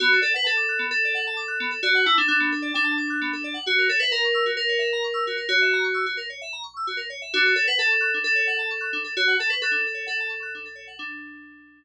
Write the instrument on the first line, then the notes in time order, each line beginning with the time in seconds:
electric piano 2
0.00 B3 F#4
0.12 A4
0.21 A4 D5
0.34 B4 F#5
0.44 A4 A5
0.57 D6
0.69 F#6
0.79 B3
0.91 A4
1.05 D5
1.15 F#5
1.27 A5
1.37 D6
1.48 F#6
1.60 B3
1.71 A4
1.83 F#4 D5
1.95 F#5
2.06 E4 A5
2.18 D4 D6
2.28 D4 F#6
2.40 B3
2.52 A4
2.62 D5
2.74 D4 G5
2.84 A5
2.98 D6
3.10 F#6
3.21 B3
3.33 A4
3.44 D5
3.54 F#5
3.67 F#4
3.78 A#4
3.89 A4 C#5
4.00 B4 E5
4.11 A#4 A#5
4.24 C#6
4.34 E6
4.46 F#4
4.57 A#4
4.69 C#5
4.79 E5
4.93 A#5
5.04 C#6
5.14 E6
5.27 F#4
5.37 A#4
5.49 F#4 C#5
5.62 E5
5.73 A#5
5.84 C#6
5.94 E6
6.06 F#4
6.17 A#4
6.30 C#5
6.41 E5
6.53 A#5
6.63 C#6
6.77 E6
6.87 F#4
6.97 A#4
7.10 C#5
7.22 E5
7.33 D4 F#4
7.46 A4
7.55 A4 C#5
7.67 B4 F#5
7.79 A4 A5
7.90 C#6
8.01 F#6
8.14 D4
8.24 A4
8.35 C#5
8.47 F#5
8.59 A5
8.71 C#6
8.81 F#6
8.93 D4
9.04 A4
9.17 F#4 C#5
9.28 F#5
9.39 A4 A5
9.50 B4 C#6
9.62 A4 F#6
9.71 D4
9.87 A4
9.94 C#5
10.06 A4 F#5
10.20 A5
10.29 C#6
10.43 F#6
10.55 D4
10.65 A4
10.75 C#5
10.87 F#5
10.99 D4